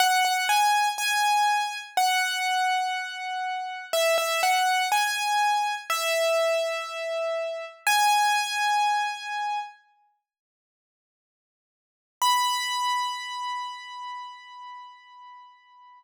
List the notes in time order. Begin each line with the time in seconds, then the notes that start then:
0.00 F#5
0.25 F#5
0.49 G#5
0.98 G#5
1.97 F#5
3.93 E5
4.18 E5
4.43 F#5
4.92 G#5
5.90 E5
7.87 G#5
12.22 B5